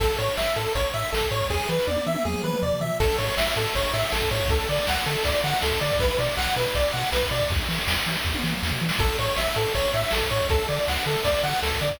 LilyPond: <<
  \new Staff \with { instrumentName = "Lead 1 (square)" } { \time 4/4 \key a \major \tempo 4 = 160 a'8 cis''8 e''8 a'8 cis''8 e''8 a'8 cis''8 | gis'8 b'8 d''8 e''8 gis'8 b'8 d''8 e''8 | a'8 cis''8 e''8 a'8 cis''8 e''8 a'8 cis''8 | a'8 d''8 fis''8 a'8 d''8 fis''8 a'8 d''8 |
b'8 d''8 fis''8 b'8 d''8 fis''8 b'8 d''8 | r1 | a'8 cis''8 e''8 a'8 cis''8 e''8 a'8 cis''8 | a'8 d''8 fis''8 a'8 d''8 fis''8 a'8 d''8 | }
  \new Staff \with { instrumentName = "Synth Bass 1" } { \clef bass \time 4/4 \key a \major a,,8 a,8 a,,8 a,8 a,,8 a,8 a,,8 a,8 | e,8 e8 e,8 e8 e,8 e8 e,8 e8 | a,,8 a,8 a,,8 a,8 a,,8 a,8 a,,8 a,8 | d,8 d8 d,8 d8 d,8 d8 d,8 d8 |
b,,8 b,8 b,,8 b,8 b,,8 b,8 b,,8 b,8 | e,8 e8 e,8 e8 e,8 e8 e,8 e8 | a,,8 a,8 a,,8 a,8 a,,8 a,8 a,,8 a,8 | d,8 d8 d,8 d8 d,8 d8 d,8 d8 | }
  \new DrumStaff \with { instrumentName = "Drums" } \drummode { \time 4/4 <cymc bd>16 hh16 hh16 hh16 sn16 hh16 hh16 hh16 <hh bd>16 hh16 hh16 hh16 sn16 <hh bd>16 hh16 <hho bd>16 | <bd sn>16 sn16 sn16 sn16 tommh16 tommh16 tommh16 tommh16 toml16 toml16 toml16 toml16 tomfh16 tomfh16 tomfh8 | <cymc bd>16 cymr16 cymr16 cymr16 sn16 cymr16 cymr16 cymr16 <bd cymr>16 cymr16 cymr16 cymr16 sn16 <bd cymr>16 cymr16 <bd cymr>16 | <bd cymr>16 cymr16 cymr16 cymr16 sn16 cymr16 cymr16 cymr16 <bd cymr>16 cymr16 cymr16 cymr16 sn16 <bd cymr>16 cymr16 <bd cymr>16 |
<bd cymr>16 cymr16 cymr16 cymr16 sn16 cymr16 cymr16 cymr16 <bd cymr>16 cymr16 cymr16 cymr16 sn16 <bd cymr>16 cymr16 <bd cymr>16 | <bd cymr>16 cymr16 cymr16 cymr16 sn16 cymr16 cymr16 cymr16 <bd sn>16 tommh16 sn16 toml16 sn16 tomfh8 sn16 | <cymc bd>16 cymr16 cymr16 cymr16 sn16 cymr16 cymr16 cymr16 <bd cymr>16 cymr16 cymr16 cymr16 sn16 <bd cymr>16 cymr16 <bd cymr>16 | <bd cymr>16 cymr16 cymr16 cymr16 sn16 cymr16 cymr16 cymr16 <bd cymr>16 cymr16 cymr16 cymr16 sn16 <bd cymr>16 cymr16 <bd cymr>16 | }
>>